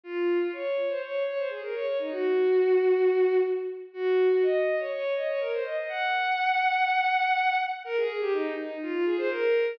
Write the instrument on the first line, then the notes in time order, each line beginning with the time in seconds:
violin
0.03 F4
0.40 F4
0.53 C#5
0.89 C5
1.02 C#5
1.27 C#5
1.38 C5
1.49 G#4
1.62 A#4
1.74 C#5
1.86 C#5
1.99 D#4
2.11 F#4
3.93 F#4
4.31 F#4
4.42 D#5
4.79 C#5
4.91 C#5
5.16 D#5
5.28 C#5
5.40 A#4
5.52 C5
5.64 D#5
5.77 D#5
5.88 F#5
7.84 A#4
7.96 G#4
8.20 G4
8.32 D#4
8.57 D#4
8.82 F4
8.93 F4
9.05 G#4
9.18 C5
9.30 A#4